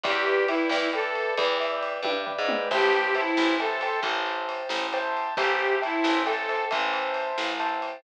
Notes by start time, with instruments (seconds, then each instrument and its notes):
0.03 electric bass (finger) E2, harmonica G4, acoustic grand piano B4 D5 E5 G5, kick, ride
0.26 acoustic grand piano B4 D5 E5 G5, ride
0.48 harmonica E4, acoustic grand piano B4 D5 E5 G5, ride
0.69 electric bass (finger) E2, acoustic grand piano B4 D5 E5 G5, snare
0.93 harmonica A4, acoustic grand piano B4 D5 E5 G5, ride
1.15 ride
1.37 electric bass (finger) E2, acoustic grand piano B4 D5 E5 G5, kick, ride
1.60 acoustic grand piano B4 D5 E5 G5, ride
1.83 ride
2.02 electric bass (finger) G2, acoustic grand piano B4 D5 E5 G5, kick, high tom
2.26 acoustic grand piano B4 D5 E5 G5, floor tom
2.38 electric bass (finger) G#2
2.48 acoustic grand piano B4 D5 E5 G5, mid tom
2.71 electric bass (finger) A1, harmonica G4, acoustic grand piano C5 E5 G5 A5, kick, crash
2.93 ride
3.15 harmonica E4, acoustic grand piano C5 E5 G5 A5, ride
3.37 electric bass (finger) A1, snare
3.60 harmonica A4, acoustic grand piano C5 E5 G5 A5, ride
3.81 acoustic grand piano C5 E5 G5 A5, ride
4.03 electric bass (finger) A1, kick, ride
4.26 ride
4.49 ride
4.69 electric bass (finger) A1, snare
4.93 acoustic grand piano C5 E5 G5 A5, ride
5.17 ride
5.37 electric bass (finger) A1, harmonica G4, acoustic grand piano C5 E5 G5 A5, kick, ride
5.59 ride
5.82 harmonica E4, acoustic grand piano C5 E5 G5 A5, ride
6.04 electric bass (finger) A1, snare
6.25 harmonica A4, acoustic grand piano C5 E5 G5 A5, ride
6.49 acoustic grand piano C5 E5 G5 A5, ride
6.71 electric bass (finger) A1, acoustic grand piano C5 E5 G5 A5, kick, ride
6.93 ride
7.14 ride
7.38 electric bass (finger) A1, snare
7.60 acoustic grand piano C5 E5 G5 A5, ride
7.82 ride